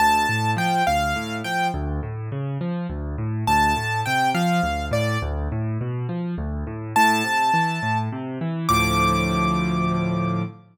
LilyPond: <<
  \new Staff \with { instrumentName = "Acoustic Grand Piano" } { \time 6/8 \key d \minor \tempo 4. = 69 a''4 g''8 f''4 g''8 | r2. | a''4 g''8 f''4 d''8 | r2. |
a''2 r4 | d'''2. | }
  \new Staff \with { instrumentName = "Acoustic Grand Piano" } { \clef bass \time 6/8 \key d \minor d,8 a,8 f8 d,8 a,8 f8 | d,8 a,8 cis8 f8 d,8 a,8 | d,8 a,8 c8 f8 d,8 a,8 | d,8 a,8 b,8 f8 d,8 a,8 |
a,8 c8 e8 a,8 c8 e8 | <d, a, f>2. | }
>>